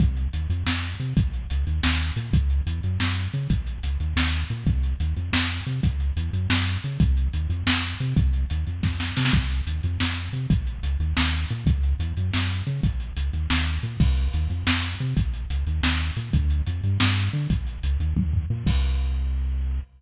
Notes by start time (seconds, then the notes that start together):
0.00 C2, kick, closed hi-hat
0.17 closed hi-hat
0.33 D#2, closed hi-hat
0.50 F2, closed hi-hat
0.66 F2, snare
0.83 closed hi-hat
1.00 C3, closed hi-hat
1.17 A#1, kick, closed hi-hat
1.33 closed hi-hat
1.50 C#2, closed hi-hat
1.67 D#2, closed hi-hat
1.83 D#2, snare
2.00 closed hi-hat
2.16 A#2, closed hi-hat
2.33 C#2, kick, closed hi-hat
2.50 closed hi-hat
2.66 E2, closed hi-hat
2.83 F#2, closed hi-hat
3.00 F#2, snare
3.17 closed hi-hat
3.33 C#3, closed hi-hat
3.50 A#1, kick, closed hi-hat
3.67 closed hi-hat
3.83 C#2, closed hi-hat
4.00 D#2, closed hi-hat
4.16 D#2, snare
4.33 closed hi-hat
4.50 A#2, closed hi-hat
4.66 C2, kick, closed hi-hat
4.83 closed hi-hat
5.00 D#2, closed hi-hat
5.16 F2, closed hi-hat
5.33 F2, snare
5.50 closed hi-hat
5.66 C3, closed hi-hat
5.83 C#2, kick, closed hi-hat
6.00 closed hi-hat
6.16 E2, closed hi-hat
6.33 F#2, closed hi-hat
6.49 F#2, snare
6.67 closed hi-hat
6.83 C#3, closed hi-hat
7.00 C2, kick, closed hi-hat
7.17 closed hi-hat
7.33 D#2, closed hi-hat
7.49 F2, closed hi-hat
7.66 F2, snare
7.83 closed hi-hat
8.00 C3, closed hi-hat
8.16 C2, kick, closed hi-hat
8.33 closed hi-hat
8.50 D#2, closed hi-hat
8.67 F2, closed hi-hat
8.83 F2, kick, snare
9.00 snare
9.17 C3, snare
9.25 snare
9.33 C2, kick, closed hi-hat
9.50 closed hi-hat
9.67 D#2, closed hi-hat
9.83 F2, closed hi-hat
10.00 F2, snare
10.17 closed hi-hat
10.33 C3, closed hi-hat
10.50 A#1, kick, closed hi-hat
10.67 closed hi-hat
10.83 C#2, closed hi-hat
11.00 D#2, closed hi-hat
11.17 D#2, snare
11.33 closed hi-hat
11.50 A#2, closed hi-hat
11.66 C#2, kick, closed hi-hat
11.83 closed hi-hat
11.99 E2, closed hi-hat
12.17 F#2, closed hi-hat
12.33 F#2, snare
12.50 closed hi-hat
12.67 C#3, closed hi-hat
12.83 A#1, kick, closed hi-hat
13.00 closed hi-hat
13.16 C#2, closed hi-hat
13.33 D#2, closed hi-hat
13.50 D#2, snare
13.67 closed hi-hat
13.83 A#2, closed hi-hat
14.00 C2, kick, crash
14.17 closed hi-hat
14.33 D#2, closed hi-hat
14.50 F2, closed hi-hat
14.67 F2, snare
14.83 closed hi-hat
15.00 C3, closed hi-hat
15.16 A#1, kick, closed hi-hat
15.34 closed hi-hat
15.50 C#2, closed hi-hat
15.67 D#2, closed hi-hat
15.83 D#2, snare
16.00 closed hi-hat
16.16 A#2, closed hi-hat
16.33 D2, kick, closed hi-hat
16.50 closed hi-hat
16.66 F2, closed hi-hat
16.83 G2, closed hi-hat
17.00 G2, snare
17.17 closed hi-hat
17.33 D3, closed hi-hat
17.50 A#1, kick, closed hi-hat
17.67 closed hi-hat
17.83 C#2, closed hi-hat
18.00 D#2, closed hi-hat
18.16 D#2, kick, high tom
18.33 floor tom
18.50 A#2
18.66 C2, kick, crash